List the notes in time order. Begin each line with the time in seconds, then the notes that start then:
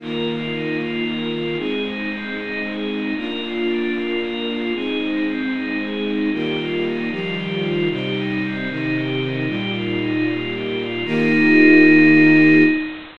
0.00 D#3 A#3 F4 A#4
0.27 F4
0.52 D#4
0.80 F4
1.04 A#4
1.32 F4
1.57 G#3 C4 D#4 G#4
1.84 D#4
2.10 C4
2.36 D#4
2.64 G#4
2.89 D#4
3.16 A#3 D4 F4 A#4
3.42 F4
3.68 D4
3.94 F4
4.22 A#4
4.47 F4
4.73 G#3 C4 D#4 G#4
5.00 D#4
5.26 C4
5.52 D#4
5.79 G#4
6.05 D#4
6.32 D#3 G3 A#3 F4 G4
6.57 F4
6.84 D#4
7.10 D#3 F3 G3 F4
7.36 G4
7.63 F4
7.89 C3 G3 D#4 G4
8.16 D#4
8.42 C4
8.69 C3 D#3 D#4
8.95 G4
9.21 D#4
9.46 A#2 G3 D#4 F4 G4
9.74 F4
10.00 D#4
10.26 F4
10.53 G4
10.78 F4
11.05 D#3 A#3 D#4 F4 G4